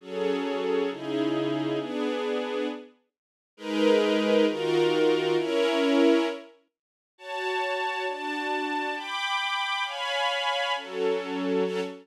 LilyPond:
\new Staff { \time 6/8 \key fis \minor \tempo 4. = 134 <fis cis' gis' a'>2. | <cis dis' e' gis'>2. | <b d' gis'>2. | r2. |
\key gis \minor <gis dis' ais' b'>2. | <dis eis' fis' ais'>2. | <cis' e' ais'>2. | r2. |
\key fis \minor <fis' cis'' a''>2. | <d' fis' a''>2. | <g'' b'' d'''>2. | <cis'' eis'' gis'' b''>2. |
<fis cis' a'>2. | <fis cis' a'>4. r4. | }